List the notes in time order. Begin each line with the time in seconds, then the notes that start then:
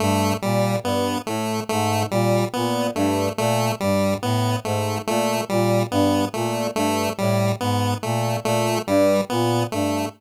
0.00 G2 A3
0.42 A#2 G3
0.83 G2 B3
1.27 A2 A3
1.69 G#2 A3
2.11 A#2 G3
2.53 A#2 B3
2.95 G2 A3
3.37 A#2 A3
3.80 G2 G3
4.22 A2 B3
4.64 G#2 A3
5.07 A#2 A3
5.49 A#2 G3
5.91 G2 B3
6.34 A#2 A3
6.75 G2 A3
7.18 A2 G3
7.61 G#2 B3
8.03 A#2 A3
8.44 A#2 A3
8.87 G2 G3
9.30 A#2 B3
9.72 G2 A3